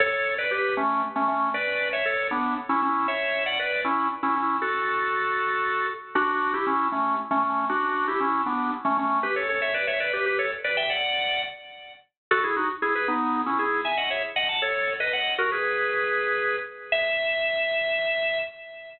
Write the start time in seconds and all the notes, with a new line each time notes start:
0.00 A4 C#5
0.38 B4 D5
0.51 G4 B4
0.77 A3 C#4
1.16 A3 C#4
1.28 A3 C#4
1.54 B4 D5
1.93 C#5 E5
2.05 A4 C#5
2.31 B3 D4
2.69 C#4 E4
2.82 C#4 E4
3.08 C#5 E5
3.46 D5 F#5
3.59 B4 D5
3.84 C#4 E4
4.23 C#4 E4
4.36 C#4 E4
4.62 F#4 A4
6.15 D4 F#4
6.54 E4 G4
6.67 C#4 E4
6.92 A3 C#4
7.31 A3 C#4
7.43 A3 C#4
7.69 D4 F#4
8.08 E4 G4
8.20 C#4 E4
8.46 B3 D4
8.85 A3 C#4
8.97 A3 C#4
9.23 G4 B4
9.36 A4 C#5
9.49 A4 C#5
9.62 C#5 E5
9.74 B4 D5
9.87 C#5 E5
10.00 B4 D5
10.13 G4 B4
10.26 G4 B4
10.39 A4 C#5
10.64 B4 D5
10.77 E5 G5
10.90 D5 F#5
12.31 F#4 A4
12.44 E4 G#4
12.56 D#4 F#4
12.82 E4 G#4
12.95 G#4 B4
13.08 B3 D#4
13.46 C#4 E4
13.59 E4 G#4
13.85 E5 G#5
13.97 D#5 F#5
14.10 C#5 E5
14.36 D#5 F#5
14.49 F#5 A5
14.62 A4 C#5
15.00 B4 D#5
15.13 D#5 F#5
15.38 F#4 A#4
15.52 G#4 B4
16.92 E5